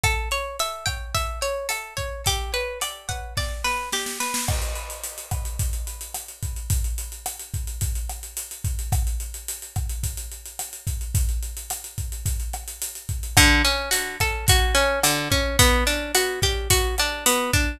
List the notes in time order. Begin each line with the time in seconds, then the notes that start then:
0.03 A4, kick, cross-stick, closed hi-hat
0.31 C#5, closed hi-hat
0.59 E5, closed hi-hat
0.86 G5, kick, cross-stick, closed hi-hat
1.15 E5, kick, closed hi-hat
1.42 C#5, closed hi-hat
1.69 A4, cross-stick, closed hi-hat
1.97 C#5, kick, closed hi-hat
2.26 G4, kick, closed hi-hat
2.54 B4, closed hi-hat
2.81 D5, cross-stick, closed hi-hat
3.09 F#5, kick, closed hi-hat
3.37 D5, kick, snare
3.64 B4, snare
3.92 G4, snare
4.06 snare
4.20 B4, snare
4.34 snare
4.48 kick, cross-stick, crash
4.62 closed hi-hat
4.75 closed hi-hat
4.90 closed hi-hat
5.04 closed hi-hat
5.18 closed hi-hat
5.31 kick, cross-stick, closed hi-hat
5.45 closed hi-hat
5.59 kick, closed hi-hat
5.73 closed hi-hat
5.87 closed hi-hat
6.01 closed hi-hat
6.14 cross-stick, closed hi-hat
6.28 closed hi-hat
6.43 kick, closed hi-hat
6.56 closed hi-hat
6.70 kick, closed hi-hat
6.84 closed hi-hat
6.98 closed hi-hat
7.12 closed hi-hat
7.26 cross-stick, closed hi-hat
7.39 closed hi-hat
7.54 kick, closed hi-hat
7.67 closed hi-hat
7.81 kick, closed hi-hat
7.95 closed hi-hat
8.09 cross-stick, closed hi-hat
8.23 closed hi-hat
8.37 closed hi-hat
8.51 closed hi-hat
8.64 kick, closed hi-hat
8.79 closed hi-hat
8.92 kick, cross-stick, closed hi-hat
9.07 closed hi-hat
9.20 closed hi-hat
9.34 closed hi-hat
9.48 closed hi-hat
9.62 closed hi-hat
9.76 kick, cross-stick, closed hi-hat
9.89 closed hi-hat
10.03 kick, closed hi-hat
10.17 closed hi-hat
10.32 closed hi-hat
10.46 closed hi-hat
10.59 cross-stick, closed hi-hat
10.73 closed hi-hat
10.87 kick, closed hi-hat
11.01 closed hi-hat
11.15 kick, closed hi-hat
11.29 closed hi-hat
11.43 closed hi-hat
11.57 closed hi-hat
11.70 cross-stick, closed hi-hat
11.84 closed hi-hat
11.98 kick, closed hi-hat
12.12 closed hi-hat
12.26 kick, closed hi-hat
12.40 closed hi-hat
12.53 cross-stick, closed hi-hat
12.68 closed hi-hat
12.82 closed hi-hat
12.95 closed hi-hat
13.09 kick, closed hi-hat
13.23 closed hi-hat
13.37 D3, kick, cross-stick, closed hi-hat
13.65 C#4, closed hi-hat
13.91 F#4, closed hi-hat
14.20 A4, kick, cross-stick, closed hi-hat
14.48 F#4, kick, closed hi-hat
14.75 C#4, closed hi-hat
15.03 D3, cross-stick, closed hi-hat
15.31 C#4, kick, closed hi-hat
15.59 B3, kick, closed hi-hat
15.87 D4, closed hi-hat
16.15 F#4, cross-stick, closed hi-hat
16.42 G4, kick, closed hi-hat
16.70 F#4, kick, closed hi-hat
16.98 D4, cross-stick, closed hi-hat
17.26 B3, closed hi-hat
17.53 D4, kick, closed hi-hat